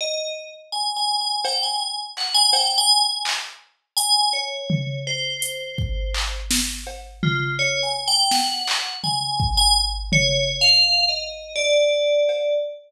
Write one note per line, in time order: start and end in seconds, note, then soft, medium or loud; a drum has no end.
0.01 0.33 D#5 medium
0.72 0.94 G#5 medium
0.97 1.18 G#5 medium
1.21 1.43 G#5 medium
1.45 1.61 G5 medium
1.45 cowbell loud
1.63 1.79 G#5 medium
1.80 1.96 G#5 soft
2.17 2.34 F#5 medium
2.17 clap medium
2.34 2.51 G#5 loud
2.53 2.75 G5 loud
2.53 cowbell loud
2.78 3.00 G#5 loud
3.02 3.23 G#5 medium
3.25 clap loud
3.97 4.29 G#5 loud
3.97 closed hi-hat loud
4.33 4.98 C#5 medium
4.70 floor tom loud
5.07 6.37 C5 medium
5.42 closed hi-hat loud
5.78 kick medium
6.14 clap loud
6.51 snare loud
6.87 cowbell medium
7.23 7.56 F4 medium
7.23 floor tom loud
7.59 7.81 C#5 medium
7.83 8.05 G#5 medium
8.08 8.29 G5 loud
8.31 8.97 F#5 medium
8.31 snare medium
8.67 clap loud
9.04 9.53 G#5 medium
9.04 floor tom medium
9.40 kick medium
9.57 9.74 G#5 loud
10.12 10.56 C#5 loud
10.12 floor tom loud
10.61 11.05 F5 loud
11.09 11.52 D#5 medium
11.56 12.53 D5 medium
12.29 cowbell medium